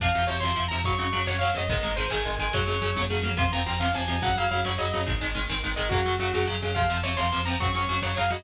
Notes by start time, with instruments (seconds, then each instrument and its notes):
0.00 synth bass 1 F2, overdriven guitar C3 F3, lead 2 (sawtooth) F5, kick, crash
0.13 synth bass 1 F2, overdriven guitar C3 F3, closed hi-hat
0.27 synth bass 1 F2, overdriven guitar C3 F3, lead 2 (sawtooth) C#5, closed hi-hat
0.40 synth bass 1 F2, overdriven guitar C3 F3, lead 2 (sawtooth) C6, snare
0.56 synth bass 1 F2, overdriven guitar C3 F3, closed hi-hat
0.68 synth bass 1 F2, overdriven guitar C3 F3, lead 2 (sawtooth) A#5, closed hi-hat
0.84 synth bass 1 F#2, overdriven guitar C#3 F#3, lead 2 (sawtooth) C#6, kick, closed hi-hat
0.98 synth bass 1 F#2, overdriven guitar C#3 F#3, lead 2 (sawtooth) C#6, closed hi-hat
1.12 synth bass 1 F#2, overdriven guitar C#3 F#3, closed hi-hat
1.26 synth bass 1 F#2, overdriven guitar C#3 F#3, lead 2 (sawtooth) C#5, snare
1.39 synth bass 1 F#2, overdriven guitar C#3 F#3, lead 2 (sawtooth) F5, closed hi-hat
1.54 synth bass 1 F#2, overdriven guitar C#3 F#3, lead 2 (sawtooth) D#5, closed hi-hat
1.68 synth bass 1 G#1, overdriven guitar D#3 G#3, lead 2 (sawtooth) D#5, kick, closed hi-hat
1.83 synth bass 1 G#1, overdriven guitar D#3 G#3, closed hi-hat
1.96 synth bass 1 G#1, overdriven guitar D#3 G#3, lead 2 (sawtooth) C5, closed hi-hat
2.10 synth bass 1 G#1, overdriven guitar D#3 G#3, lead 2 (sawtooth) G#5, snare
2.25 synth bass 1 G#1, overdriven guitar D#3 G#3, closed hi-hat
2.38 synth bass 1 G#1, overdriven guitar D#3 G#3, lead 2 (sawtooth) G#5, closed hi-hat
2.53 synth bass 1 F#2, overdriven guitar C#3 F#3, lead 2 (sawtooth) C#5, kick, closed hi-hat
2.67 synth bass 1 F#2, overdriven guitar C#3 F#3, closed hi-hat
2.82 synth bass 1 F#2, overdriven guitar C#3 F#3, closed hi-hat
2.96 synth bass 1 F#2, overdriven guitar C#3 F#3, kick, high tom
3.10 synth bass 1 F#2, overdriven guitar C#3 F#3
3.23 synth bass 1 F#2, overdriven guitar C#3 F#3, mid tom
3.37 synth bass 1 F2, overdriven guitar C3 F3, lead 2 (sawtooth) C6, kick, crash
3.52 synth bass 1 F2, overdriven guitar C3 F3, lead 2 (sawtooth) A#5, closed hi-hat
3.66 synth bass 1 F2, overdriven guitar C3 F3, lead 2 (sawtooth) A#5, closed hi-hat
3.80 synth bass 1 F2, overdriven guitar C3 F3, lead 2 (sawtooth) F5, snare
3.94 synth bass 1 F2, overdriven guitar C3 F3, lead 2 (sawtooth) G#5, closed hi-hat
4.08 synth bass 1 F2, overdriven guitar C3 F3, closed hi-hat
4.22 synth bass 1 F#2, overdriven guitar C#3 F#3, lead 2 (sawtooth) F#5, kick, closed hi-hat
4.36 synth bass 1 F#2, overdriven guitar C#3 F#3, lead 2 (sawtooth) F5, closed hi-hat
4.49 synth bass 1 F#2, overdriven guitar C#3 F#3, lead 2 (sawtooth) F5, closed hi-hat
4.64 synth bass 1 F#2, overdriven guitar C#3 F#3, lead 2 (sawtooth) C#5, snare
4.78 synth bass 1 F#2, overdriven guitar C#3 F#3, lead 2 (sawtooth) D#5, closed hi-hat
4.93 synth bass 1 F#2, overdriven guitar C#3 F#3, closed hi-hat
5.06 synth bass 1 G#1, overdriven guitar D#3 G#3, kick, closed hi-hat
5.20 synth bass 1 G#1, overdriven guitar D#3 G#3, closed hi-hat
5.34 synth bass 1 G#1, overdriven guitar D#3 G#3, closed hi-hat
5.49 synth bass 1 G#1, overdriven guitar D#3 G#3, snare
5.63 synth bass 1 G#1, overdriven guitar D#3 G#3, closed hi-hat
5.76 synth bass 1 G#1, overdriven guitar D#3 G#3, lead 2 (sawtooth) D#5, closed hi-hat
5.89 synth bass 1 F#2, overdriven guitar C#3 F#3, lead 2 (sawtooth) F#4, kick, closed hi-hat
6.05 synth bass 1 F#2, overdriven guitar C#3 F#3, closed hi-hat
6.19 synth bass 1 F#2, overdriven guitar C#3 F#3, lead 2 (sawtooth) F#4, closed hi-hat
6.34 synth bass 1 F#2, overdriven guitar C#3 F#3, lead 2 (sawtooth) F#4, snare
6.47 synth bass 1 F#2, overdriven guitar C#3 F#3, closed hi-hat
6.62 synth bass 1 F#2, overdriven guitar C#3 F#3, closed hi-hat
6.74 synth bass 1 F2, overdriven guitar C3 F3, lead 2 (sawtooth) F5, kick, crash
6.90 synth bass 1 F2, overdriven guitar C3 F3, closed hi-hat
7.03 synth bass 1 F2, overdriven guitar C3 F3, lead 2 (sawtooth) C#5, closed hi-hat
7.17 synth bass 1 F2, overdriven guitar C3 F3, lead 2 (sawtooth) C6, snare
7.31 synth bass 1 F2, overdriven guitar C3 F3, closed hi-hat
7.45 synth bass 1 F2, overdriven guitar C3 F3, lead 2 (sawtooth) A#5, closed hi-hat
7.59 synth bass 1 F#2, overdriven guitar C#3 F#3, lead 2 (sawtooth) C#6, kick, closed hi-hat
7.74 synth bass 1 F#2, overdriven guitar C#3 F#3, lead 2 (sawtooth) C#6, closed hi-hat
7.87 synth bass 1 F#2, overdriven guitar C#3 F#3, closed hi-hat
8.02 synth bass 1 F#2, overdriven guitar C#3 F#3, lead 2 (sawtooth) C#5, snare
8.17 synth bass 1 F#2, overdriven guitar C#3 F#3, lead 2 (sawtooth) F5, closed hi-hat
8.30 synth bass 1 F#2, overdriven guitar C#3 F#3, lead 2 (sawtooth) D#5, closed hi-hat